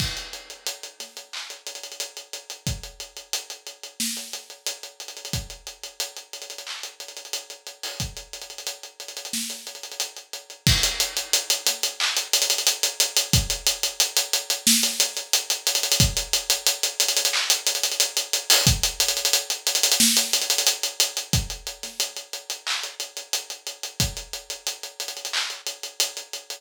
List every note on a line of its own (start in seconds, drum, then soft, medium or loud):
0.00 kick loud
0.00 crash loud
0.17 closed hi-hat medium
0.33 closed hi-hat medium
0.50 closed hi-hat medium
0.67 closed hi-hat loud
0.83 closed hi-hat medium
1.00 snare soft
1.00 closed hi-hat medium
1.17 closed hi-hat medium
1.33 clap medium
1.50 closed hi-hat medium
1.67 closed hi-hat medium
1.75 closed hi-hat medium
1.83 closed hi-hat medium
1.92 closed hi-hat medium
2.00 closed hi-hat medium
2.17 closed hi-hat medium
2.33 closed hi-hat medium
2.50 closed hi-hat medium
2.67 kick loud
2.67 closed hi-hat medium
2.83 closed hi-hat medium
3.00 closed hi-hat medium
3.17 closed hi-hat medium
3.33 closed hi-hat loud
3.50 closed hi-hat medium
3.67 closed hi-hat medium
3.83 closed hi-hat medium
4.00 snare loud
4.17 closed hi-hat medium
4.33 closed hi-hat medium
4.50 closed hi-hat medium
4.67 closed hi-hat loud
4.83 closed hi-hat medium
5.00 closed hi-hat medium
5.08 closed hi-hat medium
5.17 closed hi-hat medium
5.25 closed hi-hat medium
5.33 kick loud
5.33 closed hi-hat loud
5.50 closed hi-hat medium
5.67 closed hi-hat medium
5.83 closed hi-hat medium
6.00 closed hi-hat loud
6.17 closed hi-hat medium
6.33 closed hi-hat medium
6.42 closed hi-hat medium
6.50 closed hi-hat medium
6.58 closed hi-hat medium
6.67 clap medium
6.83 closed hi-hat medium
7.00 closed hi-hat medium
7.08 closed hi-hat medium
7.17 closed hi-hat medium
7.25 closed hi-hat medium
7.33 closed hi-hat loud
7.50 closed hi-hat medium
7.67 closed hi-hat medium
7.83 open hi-hat medium
8.00 kick medium
8.00 closed hi-hat medium
8.17 closed hi-hat medium
8.33 closed hi-hat medium
8.42 closed hi-hat medium
8.50 closed hi-hat medium
8.58 closed hi-hat medium
8.67 closed hi-hat medium
8.83 closed hi-hat medium
9.00 closed hi-hat medium
9.08 closed hi-hat medium
9.17 closed hi-hat medium
9.25 closed hi-hat medium
9.33 snare loud
9.50 closed hi-hat medium
9.67 closed hi-hat medium
9.75 closed hi-hat medium
9.83 closed hi-hat medium
9.92 closed hi-hat medium
10.00 closed hi-hat loud
10.17 closed hi-hat medium
10.33 closed hi-hat medium
10.50 closed hi-hat medium
10.67 kick loud
10.67 crash loud
10.83 closed hi-hat loud
11.00 closed hi-hat loud
11.17 closed hi-hat loud
11.33 closed hi-hat loud
11.50 closed hi-hat loud
11.67 snare soft
11.67 closed hi-hat loud
11.83 closed hi-hat loud
12.00 clap loud
12.17 closed hi-hat loud
12.33 closed hi-hat loud
12.42 closed hi-hat loud
12.50 closed hi-hat loud
12.58 closed hi-hat loud
12.67 closed hi-hat loud
12.83 closed hi-hat loud
13.00 closed hi-hat loud
13.17 closed hi-hat loud
13.33 kick loud
13.33 closed hi-hat loud
13.50 closed hi-hat loud
13.67 closed hi-hat loud
13.83 closed hi-hat loud
14.00 closed hi-hat loud
14.17 closed hi-hat loud
14.33 closed hi-hat loud
14.50 closed hi-hat loud
14.67 snare loud
14.83 closed hi-hat loud
15.00 closed hi-hat loud
15.17 closed hi-hat loud
15.33 closed hi-hat loud
15.50 closed hi-hat loud
15.67 closed hi-hat loud
15.75 closed hi-hat loud
15.83 closed hi-hat loud
15.92 closed hi-hat loud
16.00 kick loud
16.00 closed hi-hat loud
16.17 closed hi-hat loud
16.33 closed hi-hat loud
16.50 closed hi-hat loud
16.67 closed hi-hat loud
16.83 closed hi-hat loud
17.00 closed hi-hat loud
17.08 closed hi-hat loud
17.17 closed hi-hat loud
17.25 closed hi-hat loud
17.33 clap loud
17.50 closed hi-hat loud
17.67 closed hi-hat loud
17.75 closed hi-hat loud
17.83 closed hi-hat loud
17.92 closed hi-hat loud
18.00 closed hi-hat loud
18.17 closed hi-hat loud
18.33 closed hi-hat loud
18.50 open hi-hat loud
18.67 kick loud
18.67 closed hi-hat loud
18.83 closed hi-hat loud
19.00 closed hi-hat loud
19.08 closed hi-hat loud
19.17 closed hi-hat loud
19.25 closed hi-hat loud
19.33 closed hi-hat loud
19.50 closed hi-hat loud
19.67 closed hi-hat loud
19.75 closed hi-hat loud
19.83 closed hi-hat loud
19.92 closed hi-hat loud
20.00 snare loud
20.17 closed hi-hat loud
20.33 closed hi-hat loud
20.42 closed hi-hat loud
20.50 closed hi-hat loud
20.58 closed hi-hat loud
20.67 closed hi-hat loud
20.83 closed hi-hat loud
21.00 closed hi-hat loud
21.17 closed hi-hat loud
21.33 kick loud
21.33 closed hi-hat loud
21.50 closed hi-hat medium
21.67 closed hi-hat medium
21.83 snare soft
21.83 closed hi-hat medium
22.00 closed hi-hat loud
22.17 closed hi-hat medium
22.33 closed hi-hat medium
22.50 closed hi-hat medium
22.67 clap loud
22.83 closed hi-hat medium
23.00 closed hi-hat medium
23.17 closed hi-hat medium
23.33 closed hi-hat loud
23.50 closed hi-hat medium
23.67 closed hi-hat medium
23.83 closed hi-hat medium
24.00 kick loud
24.00 closed hi-hat loud
24.17 closed hi-hat medium
24.33 closed hi-hat medium
24.50 closed hi-hat medium
24.67 closed hi-hat loud
24.83 closed hi-hat medium
25.00 closed hi-hat medium
25.08 closed hi-hat medium
25.17 closed hi-hat medium
25.25 closed hi-hat medium
25.33 clap loud
25.50 closed hi-hat medium
25.67 closed hi-hat medium
25.83 closed hi-hat medium
26.00 closed hi-hat loud
26.17 closed hi-hat medium
26.33 closed hi-hat medium
26.50 closed hi-hat medium